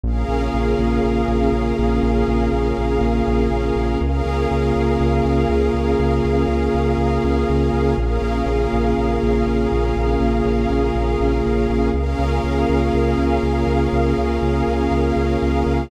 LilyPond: <<
  \new Staff \with { instrumentName = "Pad 2 (warm)" } { \time 4/4 \key des \major \tempo 4 = 121 <des bes f' aes'>1~ | <des bes f' aes'>1 | <des bes f' aes'>1~ | <des bes f' aes'>1 |
<des bes f' aes'>1~ | <des bes f' aes'>1 | <des bes f' aes'>1~ | <des bes f' aes'>1 | }
  \new Staff \with { instrumentName = "Pad 5 (bowed)" } { \time 4/4 \key des \major <des' aes' bes' f''>1~ | <des' aes' bes' f''>1 | <des' aes' bes' f''>1~ | <des' aes' bes' f''>1 |
<des' aes' bes' f''>1~ | <des' aes' bes' f''>1 | <des' aes' bes' f''>1~ | <des' aes' bes' f''>1 | }
  \new Staff \with { instrumentName = "Synth Bass 1" } { \clef bass \time 4/4 \key des \major bes,,8 bes,,8 bes,,8 bes,,8 bes,,8 bes,,8 bes,,8 bes,,8 | bes,,8 bes,,8 bes,,8 bes,,8 bes,,8 bes,,8 bes,,8 bes,,8 | des,8 des,8 des,8 des,8 des,8 des,8 des,8 des,8 | des,8 des,8 des,8 des,8 des,8 des,8 des,8 des,8 |
bes,,8 bes,,8 bes,,8 bes,,8 bes,,8 bes,,8 bes,,8 bes,,8 | bes,,8 bes,,8 bes,,8 bes,,8 bes,,8 bes,,8 bes,,8 bes,,8 | des,8 des,8 des,8 des,8 des,8 des,8 des,8 des,8 | des,8 des,8 des,8 des,8 des,8 des,8 des,8 des,8 | }
>>